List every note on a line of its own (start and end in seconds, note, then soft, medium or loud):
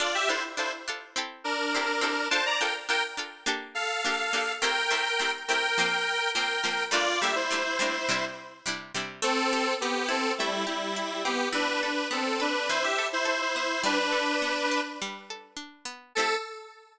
0.00 0.26 D4 loud
0.00 0.26 F4 loud
0.00 0.14 F4 medium
0.00 0.26 A4 loud
0.00 0.14 D5 medium
0.15 0.28 G4 medium
0.15 0.28 E5 medium
0.29 0.55 D4 medium
0.29 0.43 E4 medium
0.29 0.55 F4 medium
0.29 0.55 A4 medium
0.29 0.43 C5 medium
0.57 0.84 D4 medium
0.57 0.72 E4 medium
0.57 0.84 F4 medium
0.57 0.84 A4 loud
0.57 0.72 C5 medium
0.88 1.14 D4 medium
0.88 1.14 F4 medium
0.88 1.14 A4 medium
1.16 1.69 C4 loud
1.16 1.69 E4 loud
1.16 1.69 G4 medium
1.16 1.69 A4 medium
1.44 2.27 D4 medium
1.44 2.27 A#4 medium
1.75 2.01 C4 medium
1.75 2.01 E4 medium
1.75 2.01 G4 medium
1.75 2.01 A4 medium
2.01 2.28 C4 loud
2.01 2.28 E4 medium
2.01 2.28 G4 medium
2.01 2.28 A4 medium
2.30 2.58 D4 loud
2.30 2.58 F4 loud
2.30 2.58 A4 loud
2.30 2.44 C5 medium
2.30 2.44 A5 medium
2.46 2.59 D5 medium
2.46 2.59 A#5 medium
2.60 2.87 D4 medium
2.60 2.87 F4 medium
2.60 2.87 A4 medium
2.60 2.74 A#4 medium
2.60 2.74 G5 medium
2.89 3.15 D4 medium
2.89 3.15 F4 medium
2.89 3.15 A4 medium
2.89 3.02 A#4 medium
2.89 3.02 G5 medium
3.17 3.44 D4 medium
3.17 3.44 F4 medium
3.17 3.44 A4 loud
3.46 3.99 A#3 loud
3.46 3.99 D4 loud
3.46 3.99 G4 loud
3.46 3.99 A4 loud
3.75 4.53 A4 medium
3.75 4.53 F5 medium
4.05 4.31 A#3 medium
4.05 4.31 D4 loud
4.05 4.31 G4 medium
4.05 4.31 A4 medium
4.33 4.60 A#3 loud
4.33 4.60 D4 medium
4.33 4.60 G4 medium
4.33 4.60 A4 medium
4.62 4.88 A3 loud
4.62 4.88 C4 loud
4.62 4.88 E4 loud
4.62 4.88 G4 loud
4.62 5.31 A#4 medium
4.62 5.31 G5 medium
4.91 5.17 A3 medium
4.91 5.17 C4 medium
4.91 5.17 E4 medium
4.91 5.17 G4 medium
5.19 5.46 A3 medium
5.19 5.46 C4 medium
5.19 5.46 E4 medium
5.19 5.46 G4 medium
5.48 5.75 A3 medium
5.48 5.75 C4 medium
5.48 5.75 E4 medium
5.48 5.75 G4 medium
5.48 6.30 A#4 medium
5.48 6.30 G5 medium
5.78 6.31 F3 loud
5.78 6.31 A#3 loud
5.78 6.31 C4 loud
6.35 6.62 F3 loud
6.35 6.62 A#3 medium
6.35 6.62 C4 loud
6.35 6.84 A#4 medium
6.35 6.84 G5 medium
6.64 6.90 F3 medium
6.64 6.90 A#3 medium
6.64 6.90 C4 medium
6.91 7.18 G3 loud
6.91 7.18 A3 loud
6.91 7.18 A#3 loud
6.91 7.18 D4 loud
6.91 7.20 F4 medium
6.91 7.20 D5 medium
7.21 7.48 G3 medium
7.21 7.48 A3 medium
7.21 7.48 A#3 medium
7.21 7.48 D4 medium
7.21 7.35 G4 medium
7.21 7.35 E5 medium
7.36 8.25 E4 medium
7.36 8.25 C5 medium
7.50 7.77 G3 medium
7.50 7.77 A3 medium
7.50 7.77 A#3 medium
7.50 7.77 D4 medium
7.79 8.06 G3 medium
7.79 8.06 A3 medium
7.79 8.06 A#3 medium
7.79 8.06 D4 loud
8.08 8.62 C3 loud
8.08 8.62 G3 loud
8.08 8.62 D4 loud
8.08 8.62 E4 loud
8.66 8.92 C3 medium
8.66 8.92 G3 medium
8.66 8.92 D4 medium
8.66 8.92 E4 medium
8.94 9.21 C3 loud
8.94 9.21 G3 medium
8.94 9.21 D4 medium
8.94 9.21 E4 medium
9.22 10.40 A3 loud
9.22 9.74 C4 medium
9.22 9.74 A4 medium
9.53 10.66 G4 medium
9.81 10.08 B3 medium
9.81 11.25 C4 loud
9.81 10.08 G4 medium
10.09 10.32 C4 medium
10.09 10.96 E4 loud
10.09 10.32 A4 medium
10.38 10.65 G3 medium
10.38 11.50 A3 loud
10.38 10.65 E4 medium
10.67 11.23 G3 medium
10.67 11.23 E4 medium
10.67 11.49 G4 medium
10.96 11.51 E4 medium
11.25 11.48 B3 medium
11.25 11.53 C4 medium
11.25 11.48 G4 medium
11.53 12.69 E3 loud
11.53 11.81 D4 medium
11.53 11.81 B4 medium
11.83 12.08 D4 medium
11.83 12.39 A4 medium
11.83 12.08 B4 medium
12.11 13.55 B3 medium
12.11 12.39 C4 medium
12.11 12.39 A4 medium
12.40 12.68 D4 medium
12.40 12.98 A4 loud
12.40 12.68 B4 medium
12.69 13.79 E3 loud
12.69 12.83 E4 medium
12.69 12.83 C5 medium
12.83 13.07 G4 medium
12.83 13.07 E5 medium
12.99 13.25 A4 medium
13.13 13.26 E4 medium
13.13 13.26 C5 medium
13.25 13.41 E4 medium
13.25 13.80 A4 medium
13.25 13.41 C5 medium
13.41 13.55 E4 medium
13.41 13.55 C5 medium
13.56 13.83 B3 medium
13.56 13.82 E4 medium
13.56 13.82 C5 medium
13.84 15.01 G3 loud
13.84 13.98 D4 medium
13.84 13.98 B4 medium
13.99 14.81 D4 medium
13.99 14.81 B4 medium
14.12 15.30 A4 medium
14.42 15.85 B3 medium
14.71 15.56 D4 medium
15.02 16.11 G3 loud
15.30 16.12 A4 medium
15.56 16.11 D4 medium
15.85 16.13 B3 loud
16.15 16.37 A3 medium
16.15 16.37 C4 loud
16.15 16.37 E4 medium
16.15 16.35 A4 loud
16.19 16.37 G4 loud